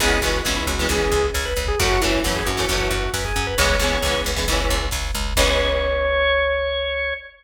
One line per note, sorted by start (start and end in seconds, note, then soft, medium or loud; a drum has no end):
0.00 0.19 C#2 medium
0.00 0.18 E3 loud
0.00 0.18 G#3 loud
0.00 0.18 B3 loud
0.00 0.18 C#4 medium
0.00 0.21 G#4 medium
0.00 kick loud
0.00 crash loud
0.10 kick medium
0.22 0.41 C#2 medium
0.22 0.41 E3 medium
0.22 0.41 G#3 medium
0.22 0.41 B3 medium
0.22 0.41 C#4 medium
0.22 0.42 F#4 medium
0.22 kick medium
0.22 closed hi-hat medium
0.34 kick medium
0.45 0.65 C#2 medium
0.45 0.72 E3 medium
0.45 0.72 G#3 medium
0.45 0.72 B3 medium
0.45 0.72 C#4 medium
0.45 kick loud
0.45 snare loud
0.56 0.67 E4 medium
0.56 kick medium
0.66 0.86 C#2 medium
0.66 0.87 F#4 medium
0.66 kick medium
0.66 closed hi-hat medium
0.78 0.88 E3 medium
0.78 0.88 G#3 medium
0.78 0.88 B3 medium
0.78 0.88 C#4 medium
0.78 kick medium
0.89 1.08 C#2 medium
0.89 1.25 E3 medium
0.89 1.25 G#3 medium
0.89 1.25 B3 medium
0.89 1.25 C#4 medium
0.89 1.26 G#4 medium
0.89 kick loud
0.89 closed hi-hat loud
1.00 kick medium
1.12 1.31 C#2 medium
1.12 kick loud
1.12 closed hi-hat medium
1.23 kick medium
1.34 1.54 C#2 medium
1.34 1.45 C#5 medium
1.34 kick medium
1.34 snare loud
1.45 1.65 B4 medium
1.45 kick medium
1.56 1.76 C#2 medium
1.56 kick medium
1.56 closed hi-hat medium
1.67 1.79 G#4 medium
1.67 kick loud
1.79 1.99 F#2 medium
1.79 1.97 E3 loud
1.79 1.97 F#3 medium
1.79 1.97 A3 loud
1.79 1.97 C#4 medium
1.79 2.01 F#4 medium
1.79 kick loud
1.79 closed hi-hat loud
1.91 kick medium
2.01 2.21 F#2 medium
2.01 2.20 E3 medium
2.01 2.20 F#3 medium
2.01 2.20 A3 loud
2.01 2.20 C#4 medium
2.01 2.23 E4 medium
2.01 kick medium
2.01 closed hi-hat medium
2.14 kick medium
2.24 2.43 F#2 medium
2.24 2.51 E3 medium
2.24 2.51 F#3 medium
2.24 2.51 A3 medium
2.24 2.51 C#4 medium
2.24 kick medium
2.24 snare loud
2.35 2.46 G#4 medium
2.35 kick medium
2.46 2.66 F#2 medium
2.46 2.68 F#4 medium
2.46 kick medium
2.46 closed hi-hat medium
2.57 2.66 E3 medium
2.57 2.66 F#3 medium
2.57 2.66 A3 medium
2.57 2.66 C#4 medium
2.57 kick medium
2.69 2.88 F#2 medium
2.69 3.05 E3 medium
2.69 3.05 F#3 medium
2.69 3.05 A3 medium
2.69 3.05 C#4 medium
2.69 3.11 F#4 medium
2.69 kick loud
2.69 closed hi-hat loud
2.80 kick medium
2.91 3.10 F#2 medium
2.91 kick medium
2.91 closed hi-hat medium
3.03 kick medium
3.14 3.33 F#2 medium
3.14 3.24 B4 medium
3.14 kick medium
3.14 snare loud
3.25 3.46 G#4 medium
3.25 kick medium
3.36 3.55 F#2 medium
3.36 kick medium
3.36 closed hi-hat medium
3.47 3.57 B4 medium
3.47 kick medium
3.58 3.77 C#2 medium
3.58 3.76 E3 loud
3.58 3.76 G#3 loud
3.58 3.76 B3 loud
3.58 3.76 C#4 loud
3.58 4.20 C#5 medium
3.58 kick loud
3.58 closed hi-hat loud
3.70 kick medium
3.79 3.99 C#2 medium
3.79 3.99 E3 medium
3.79 3.99 G#3 medium
3.79 3.99 B3 medium
3.79 kick medium
3.79 closed hi-hat medium
3.84 3.99 C#4 medium
3.91 kick medium
4.02 4.21 C#2 medium
4.02 4.31 E3 medium
4.02 4.31 G#3 medium
4.02 4.31 B3 medium
4.02 kick loud
4.02 snare loud
4.07 4.31 C#4 medium
4.15 kick medium
4.24 4.45 C#2 medium
4.24 kick medium
4.24 closed hi-hat medium
4.36 4.45 E3 medium
4.36 4.45 G#3 medium
4.36 4.45 B3 medium
4.36 4.45 C#4 medium
4.36 kick loud
4.48 4.67 C#2 medium
4.48 4.85 E3 medium
4.48 4.85 G#3 medium
4.48 4.85 B3 medium
4.48 kick medium
4.48 closed hi-hat loud
4.52 4.85 C#4 medium
4.59 kick medium
4.69 4.89 C#2 medium
4.69 kick medium
4.69 closed hi-hat medium
4.80 kick medium
4.91 5.11 C#2 medium
4.91 kick loud
4.91 snare loud
5.05 kick medium
5.14 5.34 C#2 medium
5.14 kick medium
5.14 closed hi-hat medium
5.25 kick medium
5.36 7.13 C#2 loud
5.36 7.12 E3 loud
5.36 7.12 G#3 loud
5.36 7.12 B3 loud
5.36 7.12 C#4 loud
5.36 7.14 C#5 loud
5.36 kick loud
5.36 crash loud